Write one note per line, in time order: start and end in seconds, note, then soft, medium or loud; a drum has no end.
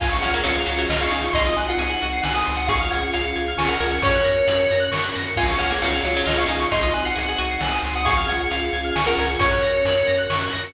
0.00 0.18 C#2 medium
0.00 1.32 C#4 medium
0.00 1.32 F4 medium
0.00 0.11 F4 loud
0.00 1.32 G#4 medium
0.00 0.19 F5 medium
0.00 0.11 G#5 medium
0.00 kick loud
0.00 crash loud
0.11 0.21 C#6 medium
0.22 0.41 C#2 medium
0.22 0.33 C#4 medium
0.22 0.33 F#5 medium
0.22 0.33 F6 medium
0.22 closed hi-hat medium
0.34 0.45 A#3 medium
0.34 0.44 G#6 medium
0.44 0.64 C#2 medium
0.44 0.54 F#3 medium
0.44 0.81 F5 medium
0.44 0.54 C#7 medium
0.44 closed hi-hat loud
0.57 0.67 F7 medium
0.66 0.86 C#2 medium
0.66 0.77 F#3 medium
0.66 0.78 C#7 medium
0.66 closed hi-hat medium
0.78 0.89 F#3 loud
0.78 0.89 G#6 medium
0.89 1.08 C#2 medium
0.89 1.10 F4 medium
0.89 1.00 D#5 medium
0.89 1.00 F6 medium
0.89 snare loud
1.01 1.22 F5 medium
1.01 1.12 C#6 medium
1.10 1.29 C#2 medium
1.10 1.31 D#4 medium
1.10 1.21 G#5 medium
1.10 closed hi-hat medium
1.23 1.33 C#6 medium
1.33 1.53 C2 loud
1.33 2.68 C4 medium
1.33 2.68 D#4 medium
1.33 1.46 D#4 medium
1.33 2.68 F#4 medium
1.33 1.56 D#5 medium
1.33 1.43 C6 medium
1.33 kick loud
1.33 closed hi-hat loud
1.45 1.56 F4 medium
1.45 1.56 D#6 medium
1.56 1.76 C2 medium
1.56 1.67 G#5 medium
1.56 1.68 F#6 medium
1.56 closed hi-hat medium
1.68 1.81 F4 medium
1.68 1.79 F#5 medium
1.68 1.79 C7 medium
1.78 1.97 C2 medium
1.78 1.89 G#4 medium
1.78 2.22 F#5 medium
1.78 1.89 D#7 medium
1.78 closed hi-hat loud
1.89 2.00 G#4 medium
1.89 2.01 F#7 medium
2.02 2.21 C2 medium
2.02 2.41 F#4 loud
2.02 2.12 D#7 medium
2.02 closed hi-hat medium
2.13 2.23 C7 medium
2.23 2.43 C2 medium
2.23 2.34 G#5 medium
2.23 2.33 F#6 medium
2.23 snare loud
2.34 2.56 G#5 medium
2.34 2.45 D#6 medium
2.46 2.89 C#2 loud
2.46 2.56 C6 medium
2.46 closed hi-hat medium
2.57 2.67 F#5 medium
2.57 2.67 D#6 medium
2.68 4.01 C#4 medium
2.68 4.01 F4 medium
2.68 4.01 G#4 medium
2.68 3.49 G#4 loud
2.68 2.89 F5 medium
2.68 2.79 C#6 medium
2.68 kick loud
2.68 closed hi-hat loud
2.81 2.91 F6 medium
2.91 3.11 C#2 medium
2.91 3.02 F#5 medium
2.91 3.01 G#6 medium
2.91 closed hi-hat loud
3.03 3.14 C#7 medium
3.13 3.34 C#2 medium
3.13 3.52 F5 medium
3.13 3.24 F7 medium
3.13 closed hi-hat loud
3.24 3.34 C#7 medium
3.36 3.55 C#2 medium
3.36 3.46 G#6 medium
3.36 closed hi-hat medium
3.48 3.58 F6 medium
3.57 3.76 C#2 medium
3.57 3.69 G#5 medium
3.57 3.68 C#6 medium
3.57 snare loud
3.68 3.79 A#4 medium
3.68 3.88 F#5 medium
3.68 3.79 F6 medium
3.80 3.99 C#2 medium
3.80 3.91 A#4 medium
3.80 3.91 G#6 medium
3.80 closed hi-hat medium
3.92 4.02 C#7 medium
4.02 4.21 F#2 medium
4.02 5.35 C#4 medium
4.02 4.61 C#4 loud
4.02 5.37 F#4 medium
4.02 5.37 A#4 medium
4.02 4.79 C#5 medium
4.02 4.12 C#6 medium
4.02 kick loud
4.02 closed hi-hat loud
4.15 4.25 F#6 medium
4.24 4.43 F#2 medium
4.24 4.34 A#6 medium
4.24 closed hi-hat medium
4.37 4.47 C#7 medium
4.47 4.67 F#2 medium
4.47 4.57 F#7 medium
4.47 closed hi-hat loud
4.59 4.69 C#7 medium
4.71 4.90 F#2 medium
4.71 4.81 A#6 medium
4.71 closed hi-hat medium
4.80 4.90 F#6 medium
4.92 5.11 F#2 medium
4.92 5.02 C#6 medium
4.92 snare loud
5.04 5.14 F#6 medium
5.15 5.35 F#2 medium
5.15 5.25 A#6 medium
5.15 closed hi-hat medium
5.26 5.37 C#7 medium
5.36 5.56 C#2 medium
5.36 6.69 C#4 medium
5.36 6.69 F4 medium
5.36 5.48 F4 loud
5.36 6.69 G#4 medium
5.36 5.56 F5 medium
5.36 5.48 G#5 medium
5.36 kick loud
5.36 crash loud
5.48 5.58 C#6 medium
5.58 5.78 C#2 medium
5.58 5.69 C#4 medium
5.58 5.70 F#5 medium
5.58 5.69 F6 medium
5.58 closed hi-hat medium
5.71 5.81 A#3 medium
5.71 5.81 G#6 medium
5.82 6.01 C#2 medium
5.82 5.94 F#3 medium
5.82 6.19 F5 medium
5.82 5.92 C#7 medium
5.82 closed hi-hat loud
5.93 6.03 F7 medium
6.03 6.22 C#2 medium
6.03 6.15 F#3 medium
6.03 6.14 C#7 medium
6.03 closed hi-hat medium
6.15 6.27 F#3 loud
6.15 6.25 G#6 medium
6.26 6.46 C#2 medium
6.26 6.46 F4 medium
6.26 6.38 D#5 medium
6.26 6.36 F6 medium
6.26 snare loud
6.38 6.59 F5 medium
6.38 6.49 C#6 medium
6.48 6.67 C#2 medium
6.48 6.68 D#4 medium
6.48 6.59 G#5 medium
6.48 closed hi-hat medium
6.60 6.70 C#6 medium
6.71 6.92 C2 loud
6.71 8.04 C4 medium
6.71 8.04 D#4 medium
6.71 6.82 D#4 medium
6.71 8.04 F#4 medium
6.71 6.94 D#5 medium
6.71 6.82 C6 medium
6.71 kick loud
6.71 closed hi-hat loud
6.83 6.93 F4 medium
6.83 6.93 D#6 medium
6.93 7.12 C2 medium
6.93 7.04 G#5 medium
6.93 7.04 F#6 medium
6.93 closed hi-hat medium
7.05 7.16 F4 medium
7.05 7.16 F#5 medium
7.05 7.15 C7 medium
7.16 7.35 C2 medium
7.16 7.26 G#4 medium
7.16 7.59 F#5 medium
7.16 7.26 D#7 medium
7.16 closed hi-hat loud
7.26 7.39 G#4 medium
7.26 7.36 F#7 medium
7.38 7.58 C2 medium
7.38 7.76 F#4 loud
7.38 7.49 D#7 medium
7.38 closed hi-hat medium
7.50 7.60 C7 medium
7.61 7.80 C2 medium
7.61 7.72 G#5 medium
7.61 7.71 F#6 medium
7.61 snare loud
7.71 7.94 G#5 medium
7.71 7.82 D#6 medium
7.83 8.24 C#2 loud
7.83 7.95 C6 medium
7.83 closed hi-hat medium
7.95 8.06 F#5 medium
7.95 8.06 D#6 medium
8.05 9.40 C#4 medium
8.05 9.40 F4 medium
8.05 8.86 G#4 loud
8.05 9.40 G#4 medium
8.05 8.26 F5 medium
8.05 8.15 C#6 medium
8.05 kick loud
8.05 closed hi-hat loud
8.17 8.27 F6 medium
8.28 8.48 C#2 medium
8.28 8.40 F#5 medium
8.28 8.38 G#6 medium
8.28 closed hi-hat loud
8.39 8.49 C#7 medium
8.50 8.70 C#2 medium
8.50 8.90 F5 medium
8.50 8.61 F7 medium
8.50 closed hi-hat loud
8.62 8.72 C#7 medium
8.73 8.92 C#2 medium
8.73 8.83 G#6 medium
8.73 closed hi-hat medium
8.85 8.95 F6 medium
8.95 9.14 C#2 medium
8.95 9.06 G#5 medium
8.95 9.06 C#6 medium
8.95 snare loud
9.06 9.17 A#4 medium
9.06 9.27 F#5 medium
9.06 9.16 F6 medium
9.17 9.36 C#2 medium
9.17 9.30 A#4 medium
9.17 9.29 G#6 medium
9.17 closed hi-hat medium
9.30 9.40 C#7 medium
9.39 9.59 F#2 medium
9.39 9.98 C#4 loud
9.39 10.74 C#4 medium
9.39 10.74 F#4 medium
9.39 10.74 A#4 medium
9.39 10.16 C#5 medium
9.39 9.50 C#6 medium
9.39 kick loud
9.39 closed hi-hat loud
9.51 9.61 F#6 medium
9.62 9.82 F#2 medium
9.62 9.73 A#6 medium
9.62 closed hi-hat medium
9.73 9.83 C#7 medium
9.85 10.04 F#2 medium
9.85 9.96 F#7 medium
9.85 closed hi-hat loud
9.97 10.07 C#7 medium
10.07 10.27 F#2 medium
10.07 10.17 A#6 medium
10.07 closed hi-hat medium
10.18 10.28 F#6 medium
10.30 10.49 F#2 medium
10.30 10.40 C#6 medium
10.30 snare loud
10.41 10.51 F#6 medium
10.53 10.73 F#2 medium
10.53 10.63 A#6 medium
10.53 closed hi-hat medium
10.64 10.74 C#7 medium